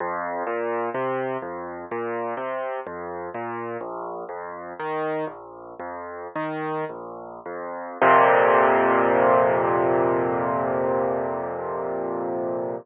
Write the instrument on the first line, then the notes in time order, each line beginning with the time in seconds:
acoustic grand piano
0.00 F2
0.47 A#2
0.94 C3
1.42 F2
1.91 A#2
2.37 C3
2.87 F2
3.34 A#2
3.81 A#1
4.29 F2
4.80 D#3
5.27 A#1
5.79 F2
6.36 D#3
6.89 A#1
7.46 F2
8.02 F2 A#2 C3